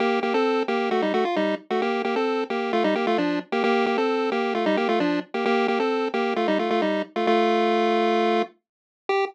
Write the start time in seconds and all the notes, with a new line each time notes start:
0.00 A#3 G4
0.23 A#3 G4
0.34 C4 A4
0.68 A#3 G4
0.91 A3 F#4
1.02 G3 D#4
1.14 A3 F#4
1.25 F4
1.36 G3 D#4
1.70 A3 F#4
1.82 A#3 G4
2.05 A#3 G4
2.16 C4 A4
2.50 A#3 G4
2.73 A3 F4
2.84 G3 D#4
2.95 A#3 G4
3.07 A3 F4
3.18 F3 D4
3.52 A#3 G4
3.64 A#3 G4
3.86 A#3 G4
3.98 C4 A4
4.32 A#3 G4
4.55 A3 F4
4.66 G3 D#4
4.77 A#3 G4
4.89 A3 F4
5.00 F3 D4
5.34 A#3 G4
5.45 A#3 G4
5.68 A#3 G4
5.80 C4 A4
6.14 A#3 G4
6.36 A3 F4
6.48 G3 D#4
6.59 A3 F4
6.70 A3 F4
6.82 G3 D#4
7.16 A3 F4
7.27 A3 F4
9.09 G4